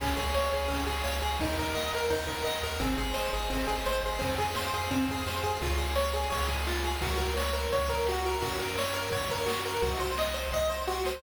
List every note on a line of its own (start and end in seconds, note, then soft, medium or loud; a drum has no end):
0.00 0.14 C#2 medium
0.00 0.17 C#4 medium
0.00 0.69 G#4 loud
0.00 kick loud
0.00 crash loud
0.16 0.33 C#2 medium
0.16 0.33 G#4 medium
0.16 0.52 C#5 medium
0.16 kick medium
0.16 ride medium
0.34 0.50 C#2 medium
0.34 0.51 C#5 medium
0.34 1.05 F5 medium
0.34 snare loud
0.52 0.68 C#2 medium
0.52 0.70 G#4 medium
0.52 0.86 C#5 medium
0.52 ride medium
0.68 0.85 C#2 medium
0.68 0.84 C#4 medium
0.68 1.36 G#4 medium
0.68 kick medium
0.68 ride loud
0.86 1.02 C#2 medium
0.86 1.03 G#4 medium
0.86 1.23 C#5 medium
0.86 kick medium
0.86 ride medium
1.04 1.21 C#2 medium
1.04 1.20 C#5 medium
1.04 1.39 F5 medium
1.04 snare loud
1.22 1.38 C#2 medium
1.22 1.38 G#4 medium
1.22 1.40 C#5 medium
1.22 ride medium
1.39 1.56 D#2 loud
1.39 1.57 D#4 medium
1.39 2.11 A#4 loud
1.39 kick loud
1.39 ride loud
1.58 1.73 D#2 medium
1.58 1.75 A#4 medium
1.58 1.91 D#5 medium
1.58 kick medium
1.58 ride medium
1.75 1.90 D#2 medium
1.75 1.91 D#5 medium
1.75 2.46 F#5 medium
1.75 snare loud
1.91 2.08 D#2 medium
1.91 2.11 A#4 medium
1.91 2.28 D#5 medium
1.91 ride medium
2.10 2.26 D#2 medium
2.10 2.26 D#4 medium
2.10 2.79 A#4 medium
2.10 kick medium
2.10 ride loud
2.27 2.44 D#2 medium
2.27 2.43 A#4 medium
2.27 2.64 D#5 medium
2.27 kick medium
2.27 ride medium
2.44 2.60 D#2 medium
2.44 2.61 D#5 medium
2.44 2.80 F#5 medium
2.44 snare loud
2.63 2.78 D#2 medium
2.63 2.79 A#4 medium
2.63 2.81 D#5 medium
2.63 ride medium
2.80 2.95 G#1 medium
2.80 2.96 C4 medium
2.80 3.50 G#4 loud
2.80 kick loud
2.80 ride loud
2.98 3.13 G#1 medium
2.98 3.14 G#4 medium
2.98 3.34 C5 medium
2.98 kick medium
2.98 ride medium
3.14 3.30 G#1 medium
3.14 3.30 C5 medium
3.14 3.86 D#5 medium
3.14 snare loud
3.32 3.48 G#1 medium
3.32 3.49 G#4 medium
3.32 3.68 C5 medium
3.32 ride medium
3.50 3.66 G#1 medium
3.50 3.66 C4 medium
3.50 4.17 G#4 medium
3.50 kick medium
3.50 ride loud
3.67 3.83 G#1 medium
3.67 3.83 G#4 medium
3.67 4.02 C5 medium
3.67 kick medium
3.67 ride medium
3.86 4.01 G#1 medium
3.86 4.02 C5 medium
3.86 4.20 D#5 medium
3.86 snare loud
4.02 4.18 G#1 medium
4.02 4.22 G#4 medium
4.02 4.19 C5 medium
4.02 ride medium
4.19 4.37 F2 medium
4.19 4.35 C4 medium
4.19 4.92 G#4 loud
4.19 kick loud
4.19 ride loud
4.38 4.54 F2 medium
4.38 4.54 G#4 medium
4.38 4.74 C5 medium
4.38 kick medium
4.38 ride medium
4.55 4.71 F2 medium
4.55 4.72 C5 medium
4.55 5.26 F5 medium
4.55 snare loud
4.73 4.88 F2 medium
4.73 4.90 G#4 medium
4.73 5.09 C5 medium
4.73 ride medium
4.91 5.07 F2 medium
4.91 5.07 C4 medium
4.91 5.59 G#4 medium
4.91 kick loud
4.91 ride medium
5.08 5.24 F2 medium
5.08 5.27 G#4 medium
5.08 5.43 C5 medium
5.08 kick medium
5.08 ride medium
5.26 5.41 F2 medium
5.26 5.43 C5 medium
5.26 5.60 F5 medium
5.26 snare loud
5.43 5.58 F2 medium
5.43 5.60 G#4 medium
5.43 5.61 C5 medium
5.43 ride medium
5.61 6.26 C#2 loud
5.61 5.78 F4 medium
5.61 5.70 G#4 medium
5.61 kick loud
5.61 ride loud
5.70 5.78 C#5 medium
5.77 5.94 G#4 medium
5.77 5.86 F5 medium
5.77 kick medium
5.77 ride medium
5.87 5.95 G#5 medium
5.95 6.12 C#5 medium
5.95 6.03 C#6 medium
5.95 snare loud
6.07 6.15 F6 medium
6.13 6.30 G#4 medium
6.13 6.23 C#6 medium
6.13 ride medium
6.23 6.31 G#5 medium
6.30 6.97 C#2 medium
6.30 6.46 C#5 medium
6.30 6.40 F5 medium
6.30 kick loud
6.30 ride loud
6.40 6.48 C#5 medium
6.48 6.64 G#4 medium
6.48 6.57 G#4 medium
6.48 kick medium
6.48 ride medium
6.58 6.66 C#5 medium
6.66 6.83 F4 medium
6.66 6.74 F5 medium
6.66 snare loud
6.76 6.84 G#5 medium
6.84 7.00 G#4 medium
6.84 6.92 C#6 medium
6.84 ride medium
6.94 7.02 F6 medium
7.01 7.67 C#2 loud
7.01 7.18 F#4 medium
7.01 7.10 A#4 loud
7.01 kick loud
7.01 ride loud
7.10 7.18 C#5 medium
7.17 7.34 A#4 medium
7.17 7.27 F#5 medium
7.17 kick medium
7.17 ride medium
7.28 7.36 A#5 medium
7.37 7.53 C#5 medium
7.37 7.45 C#6 medium
7.37 snare loud
7.47 7.55 F#6 medium
7.53 7.69 A#4 medium
7.53 7.61 C#6 medium
7.53 ride medium
7.63 7.71 A#5 medium
7.72 8.37 C#2 medium
7.72 7.89 C#5 medium
7.72 7.80 F#5 medium
7.72 kick loud
7.72 ride loud
7.81 7.89 C#5 medium
7.88 8.05 A#4 medium
7.88 7.98 A#4 medium
7.88 kick loud
7.88 ride medium
7.98 8.06 C#5 medium
8.06 8.25 F#4 medium
8.06 8.14 F#5 medium
8.06 snare loud
8.17 8.25 A#5 medium
8.24 8.42 A#4 medium
8.24 8.32 C#6 medium
8.24 ride medium
8.34 8.42 F#6 medium
8.42 9.07 F#2 loud
8.42 8.58 F#4 medium
8.42 8.51 A#4 medium
8.42 kick loud
8.42 ride loud
8.52 8.60 C#5 medium
8.59 8.75 A#4 medium
8.59 8.68 F#5 medium
8.59 kick medium
8.59 ride medium
8.68 8.76 A#5 medium
8.78 8.95 C#5 medium
8.78 8.86 C#6 medium
8.78 snare loud
8.86 8.94 F#6 medium
8.94 9.10 A#4 medium
8.94 9.03 C#6 medium
8.94 ride medium
9.04 9.12 A#5 medium
9.11 9.77 F#2 medium
9.11 9.29 C#5 medium
9.11 9.20 F#5 medium
9.11 kick loud
9.11 ride loud
9.20 9.28 C#5 medium
9.29 9.37 A#4 medium
9.29 9.47 A#4 medium
9.29 kick medium
9.29 ride medium
9.39 9.47 C#5 medium
9.46 9.62 F#4 medium
9.46 9.55 F#5 medium
9.46 snare loud
9.55 9.62 A#5 medium
9.65 9.81 A#4 medium
9.65 9.74 C#6 medium
9.65 ride medium
9.74 9.82 F#6 medium
9.82 10.47 C2 loud
9.82 9.98 F#4 medium
9.82 9.90 C5 medium
9.82 kick loud
9.82 ride loud
9.91 9.99 D#5 medium
9.99 10.16 C5 medium
9.99 10.07 F#5 medium
9.99 kick medium
9.99 ride medium
10.09 10.17 C6 medium
10.17 10.35 D#5 medium
10.17 10.25 D#6 medium
10.17 snare loud
10.26 10.34 F#6 medium
10.34 10.50 C5 medium
10.34 10.43 D#6 medium
10.34 ride medium
10.44 10.52 C6 medium
10.52 11.17 C2 loud
10.52 10.70 D#5 medium
10.52 10.61 F#5 medium
10.52 kick medium
10.52 snare medium
10.61 10.69 D#5 medium
10.69 10.86 C5 medium
10.69 10.77 C5 medium
10.80 10.88 D#5 medium
10.87 11.04 F#4 medium
10.87 10.95 F#5 medium
10.87 snare medium
10.97 11.05 C6 medium
11.05 11.22 C5 medium
11.05 11.12 D#6 medium
11.05 snare loud
11.15 11.22 F#6 medium